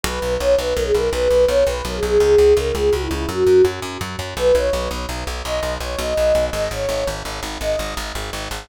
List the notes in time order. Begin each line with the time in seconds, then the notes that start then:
0.03 B1 B4
0.22 B1
0.40 B1 C#5
0.58 B1 B4
0.74 B1 A#4
0.85 G#4
0.94 B1 A#4
1.11 B1 B4
1.30 B1
1.48 B1 C#5
1.67 B1 B4
1.85 B1 A#4
1.95 G#4
2.03 B1 G#4
2.20 C#2 G#4
2.38 C#2
2.57 C#2 A#4
2.75 C#2 G#4
2.91 C#2 F#4
3.01 E4
3.11 C#2 E4
3.29 F#2 F#4
3.47 F#2
3.65 F#2
3.82 F#2
4.01 F#2
4.19 F#2
4.37 B1 B4
4.55 B1 C#5
4.73 B1
4.91 B1
5.09 B1
5.27 B1
5.44 B1 D#5
5.63 B1
5.80 B1 C#5
5.97 B1 D#5
6.17 B1
6.35 B1
6.53 G#1 D#5
6.71 G#1 C#5
6.89 G#1
7.07 G#1
7.25 G#1
7.43 G#1
7.61 G#1 D#5
7.79 G#1
7.97 G#1
8.15 G#1
8.33 G#1
8.51 G#1